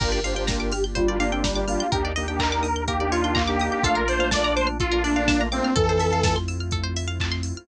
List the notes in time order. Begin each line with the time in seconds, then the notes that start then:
0.00 G1 A#3 D4 F4 G4 A#4, kick, crash
0.12 A#4 D5
0.23 A#3 D4 F4 G4 C5 F5, open hi-hat
0.34 A#3 D4 F4 G4 G5
0.47 A#4 A#5, kick, snare
0.60 D6
0.72 G4 F6, open hi-hat
0.84 G6
0.95 G3 F4 C5, kick, closed hi-hat
1.08 A#3 D4 F4 G4 D5
1.20 A#3 D4 F5, open hi-hat
1.32 C4 G5
1.44 G3 A#5, kick, snare
1.55 A#3 D4 F4 G4 D6
1.68 A#3 D4 F4 G4 F6, open hi-hat
1.80 G6
1.92 D#2 A#3 D4 D#4 G4 A#4, kick, closed hi-hat
2.05 D5
2.16 A#3 D4 D#4 G4 D#5, open hi-hat
2.28 A#3 D4 D#4 G4 G5
2.39 A#4 A#5, kick, clap
2.52 D6
2.63 D#6, open hi-hat
2.76 G6
2.87 A#3 G4 A#4, kick, closed hi-hat
2.99 A#3 D4 D#4 G4 D5
3.11 F4 C#5, open hi-hat
3.24 D4 G5
3.35 A#3 A#5, kick, clap
3.48 A#3 D4 D#4 G4 D6
3.60 A#3 D4 D#4 G4 D#6, open hi-hat
3.71 G4 G6
3.83 A#1 A3 A#3 D4 F4 A4 F5, kick, closed hi-hat
3.95 A#4
4.08 A3 A#3 D4 F4 C5 D5, open hi-hat
4.19 A3 A#3 D4 F4 F5
4.31 D4 D5 A5, kick, snare
4.44 A#5
4.56 C5 D6, open hi-hat
4.67 F6
4.80 F4 A4, kick, closed hi-hat
4.92 A3 A#3 D4 F4 A#4
5.03 D4 D5, open hi-hat
5.16 F5
5.28 A#3 A5, kick, snare
5.39 A3 A#3 D4 F4 A#5
5.51 A3 A#3 C4 D4 F4 D6, open hi-hat
5.64 F6
5.76 F2 E3 A3 C4 E4 F4 A4, kick, closed hi-hat
5.89 C5
6.00 E5, open hi-hat
6.13 F5
6.23 A5, kick, snare
6.36 C6
6.48 E6, open hi-hat
6.60 F6
6.71 A4, kick, closed hi-hat
6.83 C5
6.96 E5, open hi-hat
7.08 F5
7.20 A5, kick, clap
7.32 C6
7.43 E6, open hi-hat
7.57 F6